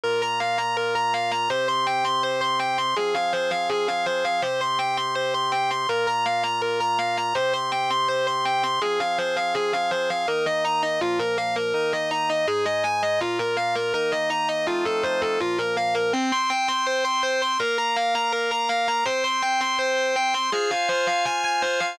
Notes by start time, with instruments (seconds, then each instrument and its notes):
0.04 drawbar organ A#2 A#3 F4, distortion guitar A#4
0.22 distortion guitar A#5
0.40 distortion guitar F5
0.58 distortion guitar A#5
0.77 distortion guitar A#4
0.95 distortion guitar A#5
1.14 distortion guitar F5
1.31 distortion guitar A#5
1.50 drawbar organ C3 C4 G4, distortion guitar C5
1.68 distortion guitar C6
1.87 distortion guitar G5
2.04 distortion guitar C6
2.23 distortion guitar C5
2.41 distortion guitar C6
2.59 distortion guitar G5
2.78 distortion guitar C6
2.96 drawbar organ F3 C4 G#4, distortion guitar G#4
3.15 distortion guitar F5
3.33 distortion guitar C5
3.51 distortion guitar F5
3.69 distortion guitar G#4
3.88 distortion guitar F5
4.06 distortion guitar C5
4.25 distortion guitar F5
4.42 drawbar organ C3 C4 G4, distortion guitar C5
4.61 distortion guitar C6
4.79 distortion guitar G5
4.97 distortion guitar C6
5.15 distortion guitar C5
5.34 distortion guitar C6
5.52 distortion guitar G5
5.71 distortion guitar C6
5.89 drawbar organ A#2 A#3 F4, distortion guitar A#4
6.07 distortion guitar A#5
6.26 distortion guitar F5
6.43 distortion guitar A#5
6.62 distortion guitar A#4
6.80 distortion guitar A#5
6.99 distortion guitar F5
7.17 distortion guitar A#5
7.35 drawbar organ C3 C4 G4, distortion guitar C5
7.53 distortion guitar C6
7.72 distortion guitar G5
7.90 distortion guitar C6
8.08 distortion guitar C5
8.27 distortion guitar C6
8.45 distortion guitar G5
8.63 distortion guitar C6
8.82 drawbar organ F3 C4 G#4, distortion guitar G#4
9.00 distortion guitar F5
9.18 distortion guitar C5
9.36 distortion guitar F5
9.55 distortion guitar G#4
9.73 distortion guitar F5
9.91 distortion guitar C5
10.10 distortion guitar F5
10.28 drawbar organ D#3 A#3 D#4, distortion guitar A#4
10.46 distortion guitar D#5
10.65 distortion guitar A#5
10.82 distortion guitar D#5
11.01 drawbar organ A#2 F3 A#3, distortion guitar F4
11.19 distortion guitar A#4
11.38 distortion guitar F5
11.56 distortion guitar A#4
11.74 drawbar organ D#3 A#3 D#4, distortion guitar A#4
11.93 distortion guitar D#5
12.11 distortion guitar A#5
12.29 distortion guitar D#5
12.47 drawbar organ G#2 G#3 D#4, distortion guitar G#4
12.65 distortion guitar D#5
12.84 distortion guitar G#5
13.03 distortion guitar D#5
13.21 drawbar organ A#2 A#3 F4, distortion guitar F4
13.39 distortion guitar A#4
13.57 distortion guitar F5
13.75 distortion guitar A#4
13.94 drawbar organ D#3 A#3 D#4, distortion guitar A#4
14.12 distortion guitar D#5
14.30 distortion guitar A#5
14.49 distortion guitar D#5
14.67 drawbar organ F3 A3 C4 D#4, distortion guitar F4
14.85 distortion guitar A4
15.03 distortion guitar C5
15.21 distortion guitar A4
15.40 drawbar organ A#2 F3 A#3, distortion guitar F4
15.58 distortion guitar A#4
15.77 distortion guitar F5
15.95 distortion guitar A#4
16.13 distortion guitar C4, drawbar organ C4 C5 G5
16.32 distortion guitar C6
16.50 distortion guitar G5
16.68 distortion guitar C6
16.87 distortion guitar C5
17.04 distortion guitar C6
17.23 distortion guitar C5
17.42 distortion guitar C6
17.59 drawbar organ A#3 A#4 F5, distortion guitar A#4
17.78 distortion guitar A#5
17.96 distortion guitar F5
18.15 distortion guitar A#5
18.32 distortion guitar A#4
18.51 distortion guitar A#5
18.69 distortion guitar F5
18.88 distortion guitar A#5
19.05 drawbar organ C4 C5 G5, distortion guitar C5
19.24 distortion guitar C6
19.42 distortion guitar G5
19.61 distortion guitar C6
19.79 distortion guitar C5
19.97 distortion guitar C5
20.16 distortion guitar G5
20.34 distortion guitar C6
20.52 drawbar organ F4 C5 G#5, distortion guitar G#4
20.71 distortion guitar F5
20.89 distortion guitar C5
21.07 distortion guitar F5
21.25 distortion guitar G#5
21.44 distortion guitar G#5
21.62 distortion guitar C5
21.80 distortion guitar F5